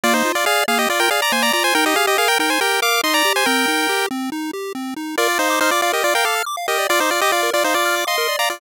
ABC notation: X:1
M:4/4
L:1/16
Q:1/4=140
K:Eb
V:1 name="Lead 1 (square)"
[Fd] [Ec]2 [Fd] [Af]2 [Af] [Ge] [Fd] [Bg] [Af] [db] [ca] [db] [db] [ca] | [Bg] [Ge] [Af] [Ge] [Af] [Bg] [Bg] [ca] [Bg]2 [fd']2 [ec'] [db]2 [ca] | [Bg]6 z10 | [K:Bb] [Fd]2 [Ec]2 [Ec] [Fd] [Fd] [Ge] [Fd] [Bg] [Af]2 z2 [Ge]2 |
[Fd] [Ec] [Fd] [Ge] [Fd]2 [Fd] [Ec] [Fd]3 [ec']3 [db] [Fd] |]
V:2 name="Lead 1 (square)"
B,2 F2 d2 B,2 F2 d2 B,2 F2 | E2 G2 B2 E2 G2 B2 E2 G2 | C2 E2 G2 C2 E2 G2 C2 E2 | [K:Bb] B d f d' f' d' f B d f d' f' d' f B d |
f d' f' d' f B d f d' f' d' f B d f d' |]